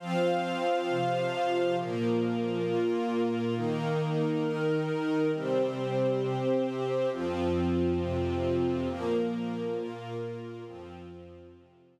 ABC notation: X:1
M:4/4
L:1/8
Q:1/4=135
K:Fmix
V:1 name="Pad 5 (bowed)"
[F,CF]4 [C,F,F]4 | [B,,F,B,]4 [B,,B,F]4 | [E,B,E]4 [E,EB]4 | [C,G,C]4 [C,CG]4 |
[F,,F,C]4 [F,,C,C]4 | [B,,F,B,]4 [B,,B,F]4 | [F,,F,C]4 [F,,C,C]4 |]
V:2 name="String Ensemble 1"
[Fcf]8 | [B,FB]8 | [E,EB]8 | [CGc]8 |
[F,CF]8 | [B,FB]8 | [F,CF]8 |]